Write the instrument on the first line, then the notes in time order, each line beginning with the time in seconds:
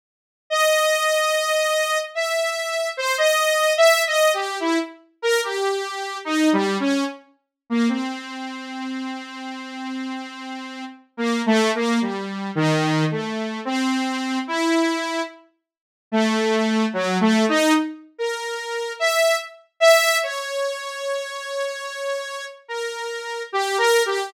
lead 2 (sawtooth)
0.50 D#5
2.15 E5
2.97 C5
3.18 D#5
3.77 E5
4.07 D#5
4.34 G4
4.60 E4
5.22 A#4
5.44 G4
6.25 D#4
6.53 G3
6.80 C#4
7.70 A#3
7.89 C4
11.17 A#3
11.46 A3
11.75 A#3
12.01 G3
12.55 D#3
13.11 A3
13.65 C4
14.47 E4
16.12 A3
16.93 F#3
17.21 A3
17.49 D#4
18.18 A#4
18.99 E5
19.80 E5
20.23 C#5
22.68 A#4
23.52 G4
23.78 A#4
24.06 G4